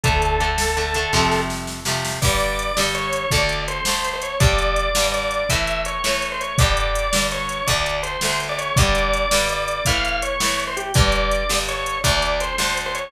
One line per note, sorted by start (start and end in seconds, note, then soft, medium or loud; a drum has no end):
0.03 1.06 D2 medium
0.03 0.38 D3 loud
0.03 0.38 A3 loud
0.03 1.38 A4 medium
0.03 kick medium
0.03 closed hi-hat medium
0.22 closed hi-hat medium
0.40 0.74 D3 medium
0.40 0.74 A3 medium
0.40 closed hi-hat medium
0.58 snare loud
0.77 0.94 D3 medium
0.77 0.94 A3 medium
0.77 closed hi-hat medium
0.94 1.12 D3 medium
0.94 1.12 A3 loud
0.94 closed hi-hat medium
1.13 2.13 F2 medium
1.13 1.80 C3 loud
1.13 1.80 F3 loud
1.13 1.80 A3 loud
1.13 kick medium
1.13 snare medium
1.32 snare medium
1.50 snare medium
1.67 snare medium
1.85 2.19 C3 medium
1.85 2.19 F3 medium
1.85 2.19 A3 medium
1.85 snare medium
2.05 snare medium
2.22 2.71 G2 loud
2.22 2.71 D3 medium
2.22 2.71 G3 loud
2.22 2.81 D5 medium
2.22 kick medium
2.22 crash medium
2.40 closed hi-hat medium
2.59 closed hi-hat medium
2.77 3.26 G2 medium
2.77 3.26 D3 medium
2.77 3.26 G3 medium
2.77 snare loud
2.95 3.30 C#5 medium
2.95 closed hi-hat medium
3.13 closed hi-hat medium
3.31 3.80 D2 loud
3.31 3.80 D3 loud
3.31 3.80 A3 loud
3.31 3.62 D5 medium
3.31 kick medium
3.31 closed hi-hat medium
3.49 closed hi-hat medium
3.68 4.08 C5 medium
3.68 closed hi-hat medium
3.85 4.35 D2 medium
3.85 4.35 D3 medium
3.85 4.35 A3 medium
3.85 snare loud
4.04 closed hi-hat medium
4.13 4.22 C5 medium
4.22 4.38 C#5 medium
4.22 closed hi-hat medium
4.40 4.89 G2 loud
4.40 4.89 D3 loud
4.40 4.89 G3 loud
4.40 5.05 D5 loud
4.40 kick loud
4.40 closed hi-hat medium
4.58 closed hi-hat medium
4.76 closed hi-hat medium
4.95 5.44 G2 medium
4.95 5.44 D3 medium
4.95 5.44 G3 medium
4.95 snare loud
5.12 5.46 D5 medium
5.12 closed hi-hat medium
5.31 closed hi-hat medium
5.49 5.99 A2 loud
5.49 5.99 E3 medium
5.49 5.99 A3 loud
5.49 5.81 E5 medium
5.49 kick medium
5.49 closed hi-hat loud
5.67 closed hi-hat medium
5.85 6.27 C#5 medium
5.85 closed hi-hat medium
6.04 6.53 A2 medium
6.04 6.53 E3 medium
6.04 6.53 A3 medium
6.04 snare medium
6.22 closed hi-hat medium
6.32 6.40 C5 medium
6.41 6.56 C#5 medium
6.41 closed hi-hat medium
6.58 7.08 G2 loud
6.58 7.08 D3 loud
6.58 7.08 G3 loud
6.58 7.24 D5 medium
6.58 kick loud
6.58 closed hi-hat medium
6.77 closed hi-hat medium
6.95 closed hi-hat medium
7.13 7.62 G2 medium
7.13 7.62 D3 medium
7.13 7.62 G3 medium
7.13 snare loud
7.31 7.67 C#5 medium
7.31 closed hi-hat medium
7.49 closed hi-hat medium
7.67 8.17 D2 loud
7.67 8.17 D3 loud
7.67 8.17 A3 medium
7.67 7.97 D5 medium
7.67 kick medium
7.67 closed hi-hat medium
7.86 closed hi-hat medium
8.03 8.41 C5 medium
8.03 closed hi-hat medium
8.21 8.71 D2 medium
8.21 8.71 D3 medium
8.21 8.71 A3 medium
8.21 snare loud
8.40 closed hi-hat medium
8.49 8.58 D5 medium
8.58 8.76 C#5 medium
8.58 closed hi-hat medium
8.76 9.26 G2 medium
8.76 9.26 D3 loud
8.76 9.26 G3 loud
8.76 9.45 D5 loud
8.76 kick loud
8.76 closed hi-hat loud
8.95 closed hi-hat medium
9.13 closed hi-hat medium
9.31 9.81 G2 medium
9.31 9.81 D3 medium
9.31 9.81 G3 medium
9.31 snare loud
9.49 9.85 D5 medium
9.49 closed hi-hat medium
9.68 closed hi-hat medium
9.85 10.35 A2 loud
9.85 10.35 E3 loud
9.85 10.35 A3 loud
9.85 10.19 F5 medium
9.85 kick medium
9.85 closed hi-hat loud
10.05 closed hi-hat medium
10.22 10.62 C#5 medium
10.22 closed hi-hat medium
10.40 10.89 A2 medium
10.40 10.89 E3 medium
10.40 10.89 A3 medium
10.40 snare loud
10.60 closed hi-hat medium
10.67 10.76 C5 medium
10.77 10.93 G4 medium
10.77 closed hi-hat medium
10.94 11.44 G2 loud
10.94 11.44 D3 loud
10.94 11.44 G3 loud
10.94 11.57 D5 loud
10.94 kick loud
10.94 closed hi-hat medium
11.12 closed hi-hat medium
11.31 closed hi-hat medium
11.49 11.98 G2 medium
11.49 11.98 D3 medium
11.49 11.98 G3 medium
11.49 snare loud
11.68 11.98 C#5 medium
11.68 closed hi-hat medium
11.86 closed hi-hat medium
12.04 12.53 D2 loud
12.04 12.53 D3 medium
12.04 12.53 A3 loud
12.04 12.38 D5 medium
12.04 kick medium
12.04 closed hi-hat loud
12.22 closed hi-hat medium
12.40 12.78 C5 medium
12.40 closed hi-hat medium
12.58 13.07 D2 medium
12.58 13.07 D3 medium
12.58 13.07 A3 medium
12.58 snare medium
12.77 closed hi-hat medium
12.86 12.95 C5 medium
12.95 13.11 C#5 medium
12.95 closed hi-hat medium